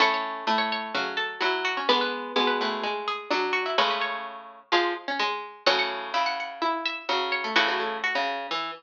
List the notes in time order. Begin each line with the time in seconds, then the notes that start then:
0.00 A2 A3 C#4 A4 C#5
0.14 C#5
0.47 A2 A3
0.58 C#5
0.72 C#5
0.94 C#3 F#3 F#4
1.17 A4
1.41 F#3 E4 E5
1.65 F#4
1.77 C#4 C#5
1.89 D3 G#3 B3 B4
2.01 B4
2.36 B2 G#3 B3
2.47 B4
2.61 A2 B4
2.83 G#3 G#4
3.08 G#4
3.31 F#3 D4 D5
3.53 F#4
3.66 E4 E5
3.78 A2 C#3 G#3 C#4 B4 C#5
3.91 B4
4.01 C#5
4.72 F3 G#3 F4 F5
5.08 C#4 C#5
5.19 G#3
5.66 A2 C#3 F#3 C#4 C#5 F#5
5.79 F#5
6.14 C#3 E4 E5
6.26 F#5
6.40 F#5
6.62 E4 E5
6.86 E5
7.09 C#3 F#3 F#4
7.32 C#5
7.44 A3 A4
7.56 A2 C#3 E3 E4 F#4
7.68 E3 F#3 F#4
7.80 A3 A4
8.04 F#4
8.15 C#3
8.51 E3